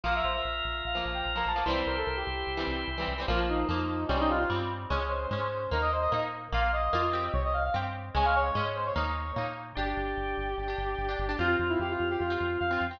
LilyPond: <<
  \new Staff \with { instrumentName = "Brass Section" } { \time 4/4 \key g \dorian \tempo 4 = 148 f''16 e''16 c''16 e''4~ e''16 f''8 r16 g''16 r16 bes''16 a''8 | c''8 bes'16 a'16 bes'16 g'4~ g'16 r4. | \key bes \dorian f'8 ees'4. des'16 ees'16 f'16 f'16 r4 | des''8 c''4. bes'16 ees''16 c''16 ees''16 r4 |
f''8 ees''4. des''16 ees''16 f''16 f''16 r4 | aes''16 f''16 des''8. r16 c''16 des''4~ des''16 r4 | \key g \dorian g'1 | f'8 f'16 e'16 g'16 f'8 g'16 f'4 f''8. g''16 | }
  \new Staff \with { instrumentName = "Acoustic Guitar (steel)" } { \time 4/4 \key g \dorian <f bes>2~ <f bes>16 <f bes>4 <f bes>8 <f bes>16 | <e g c'>2~ <e g c'>16 <e g c'>4 <e g c'>8 <e g c'>16 | \key bes \dorian <f bes>4 <f bes>4 <g c'>4 <g c'>4 | <aes des'>4 <aes des'>4 <bes ees'>4 <bes ees'>4 |
<bes f'>4 <bes f'>8 <c' g'>4. <c' g'>4 | <aes des'>4 <aes des'>4 <bes ees'>4 <bes ees'>4 | \key g \dorian <d' g'>2~ <d' g'>16 <d' g'>4 <d' g'>8 <d' g'>16 | <c' f'>2~ <c' f'>16 <c' f'>4 <c' f'>8 <c' f'>16 | }
  \new Staff \with { instrumentName = "Drawbar Organ" } { \time 4/4 \key g \dorian <f' bes'>1 | <e' g' c''>1 | \key bes \dorian r1 | r1 |
r1 | r1 | \key g \dorian <d' g'>2 <d' g'>2 | <c' f'>2 <c' f'>2 | }
  \new Staff \with { instrumentName = "Synth Bass 1" } { \clef bass \time 4/4 \key g \dorian bes,,8 bes,,8 bes,,8 bes,,8 bes,,8 bes,,8 bes,,8 bes,,8 | c,8 c,8 c,8 c,8 c,8 c,8 c,8 c,8 | \key bes \dorian bes,,4 f,4 c,4 g,4 | des,4 aes,4 ees,4 bes,4 |
bes,,4 f,4 c,4 g,4 | des,4 aes,4 ees,4 bes,4 | \key g \dorian g,,8 g,,8 g,,8 g,,8 g,,8 g,,8 g,,8 g,,8 | f,8 f,8 f,8 f,8 f,8 f,8 f,8 f,8 | }
>>